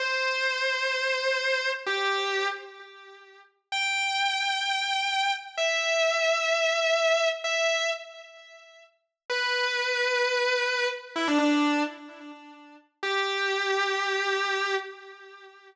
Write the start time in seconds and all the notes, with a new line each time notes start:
0.00 C5
1.86 G4
3.72 G5
5.57 E5
7.44 E5
9.30 B4
11.16 E4
11.27 D4
11.38 D4
13.03 G4